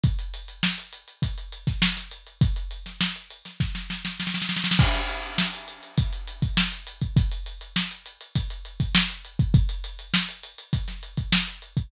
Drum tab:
CC |--------------------------------|--------------------------------|x-------------------------------|--------------------------------|
HH |x-x-x-x---x-x-x-x-x-x-x---x-x-x-|x-x-x-x---x-x-x-----------------|--x-x-x---x-x-x-x-x-x-x---x-x-x-|x-x-x-x---x-x-x-x-x-x-x---x-x-x-|
SD |--------o-------------o-o-o-----|------o-o-----o-o-o-o-o-oooooooo|--o-----o---------------o-------|--------o---------------o-------|
BD |o---------------o-----o---------|o---------------o---------------|o---------------o-----o-------o-|o---------------o-----o-------o-|

CC |--------------------------------|
HH |x-x-x-x---x-x-x-x-x-x-x---x-x-x-|
SD |--------o---------o-----o-------|
BD |o---------------o-----o-------o-|